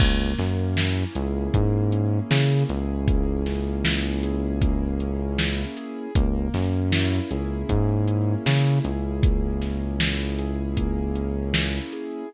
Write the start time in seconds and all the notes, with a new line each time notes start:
0.00 C#2 A#3, kick, crash
0.38 F#2 C#4, snare, closed hi-hat
0.77 E4, snare
1.15 C#2 G#4, closed hi-hat
1.54 G#2 A#3, kick, closed hi-hat
1.92 C#4, closed hi-hat
2.30 C#3 E4, snare
2.69 C#2 G#4, closed hi-hat
3.08 A#3, kick, closed hi-hat
3.46 C#4, snare, closed hi-hat
3.85 E4, snare
4.23 G#4, closed hi-hat
4.61 A#3, kick, closed hi-hat
5.00 C#4, closed hi-hat
5.38 E4, snare
5.77 G#4, closed hi-hat
6.15 C#2 A#3, kick, closed hi-hat
6.54 F#2 C#4, snare, closed hi-hat
6.92 E4, snare
7.31 C#2 G#4, closed hi-hat
7.69 G#2 A#3, kick, closed hi-hat
8.07 C#4, closed hi-hat
8.46 C#3 E4, snare
8.85 C#2 G#4, closed hi-hat
9.23 A#3, kick, closed hi-hat
9.62 C#4, snare, closed hi-hat
10.00 E4, snare
10.38 G#4, closed hi-hat
10.77 A#3, kick, closed hi-hat
11.15 C#4, closed hi-hat
11.54 E4, snare
11.92 G#4, closed hi-hat